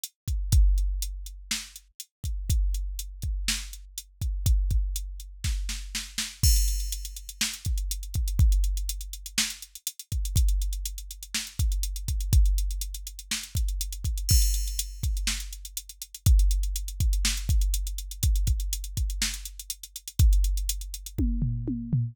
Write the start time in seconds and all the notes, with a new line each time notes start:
0.03 closed hi-hat
0.28 kick, closed hi-hat
0.52 kick, closed hi-hat
0.78 closed hi-hat
1.02 closed hi-hat
1.26 closed hi-hat
1.51 snare
1.76 closed hi-hat
2.00 closed hi-hat
2.24 kick, closed hi-hat
2.50 kick, closed hi-hat
2.74 closed hi-hat
2.99 closed hi-hat
3.22 kick, closed hi-hat
3.48 snare
3.73 closed hi-hat
3.98 closed hi-hat
4.22 kick, closed hi-hat
4.46 kick, closed hi-hat
4.70 kick, closed hi-hat
4.96 closed hi-hat
5.20 closed hi-hat
5.44 kick, snare
5.69 snare
5.95 snare
6.18 snare
6.43 kick, crash
6.56 closed hi-hat
6.68 closed hi-hat
6.80 closed hi-hat
6.92 closed hi-hat
7.05 closed hi-hat
7.16 closed hi-hat
7.29 closed hi-hat
7.41 snare
7.53 closed hi-hat
7.65 kick, closed hi-hat
7.78 closed hi-hat
7.91 closed hi-hat
8.03 closed hi-hat
8.14 kick, closed hi-hat
8.28 closed hi-hat
8.39 kick, closed hi-hat
8.52 closed hi-hat
8.64 closed hi-hat
8.77 closed hi-hat
8.89 closed hi-hat
9.01 closed hi-hat
9.13 closed hi-hat
9.26 closed hi-hat
9.38 snare
9.50 closed hi-hat
9.62 closed hi-hat
9.75 closed hi-hat
9.87 closed hi-hat
9.99 closed hi-hat
10.12 kick, closed hi-hat
10.25 closed hi-hat
10.36 kick, closed hi-hat
10.48 closed hi-hat
10.62 closed hi-hat
10.73 closed hi-hat
10.85 closed hi-hat
10.98 closed hi-hat
11.11 closed hi-hat
11.23 closed hi-hat
11.34 snare
11.47 closed hi-hat
11.59 kick, closed hi-hat
11.72 closed hi-hat
11.83 closed hi-hat
11.96 closed hi-hat
12.08 kick, closed hi-hat
12.20 closed hi-hat
12.33 kick, closed hi-hat
12.46 closed hi-hat
12.58 closed hi-hat
12.71 closed hi-hat
12.81 closed hi-hat
12.94 closed hi-hat
13.07 closed hi-hat
13.19 closed hi-hat
13.31 snare
13.43 closed hi-hat
13.55 kick, closed hi-hat
13.68 closed hi-hat
13.81 closed hi-hat
13.92 closed hi-hat
14.04 kick, closed hi-hat
14.18 closed hi-hat
14.29 kick, crash
14.42 closed hi-hat
14.54 closed hi-hat
14.67 closed hi-hat
14.79 closed hi-hat
15.03 kick, closed hi-hat
15.17 closed hi-hat
15.27 snare
15.40 closed hi-hat
15.53 closed hi-hat
15.65 closed hi-hat
15.77 closed hi-hat
15.89 closed hi-hat
16.02 closed hi-hat
16.14 closed hi-hat
16.26 kick, closed hi-hat
16.39 closed hi-hat
16.51 closed hi-hat
16.63 closed hi-hat
16.76 closed hi-hat
16.88 closed hi-hat
17.00 kick, closed hi-hat
17.13 closed hi-hat
17.25 snare
17.37 closed hi-hat
17.49 kick, closed hi-hat
17.61 closed hi-hat
17.74 closed hi-hat
17.87 closed hi-hat
17.98 closed hi-hat
18.11 closed hi-hat
18.23 kick, closed hi-hat
18.35 closed hi-hat
18.47 kick, closed hi-hat
18.60 closed hi-hat
18.73 closed hi-hat
18.84 closed hi-hat
18.97 kick, closed hi-hat
19.10 closed hi-hat
19.22 snare
19.34 closed hi-hat
19.45 closed hi-hat
19.59 closed hi-hat
19.70 closed hi-hat
19.83 closed hi-hat
19.96 closed hi-hat
20.08 closed hi-hat
20.19 kick, closed hi-hat
20.33 closed hi-hat
20.44 closed hi-hat
20.57 closed hi-hat
20.69 closed hi-hat
20.81 closed hi-hat
20.94 closed hi-hat
21.06 closed hi-hat
21.18 kick, high tom
21.42 floor tom
21.68 high tom
21.93 floor tom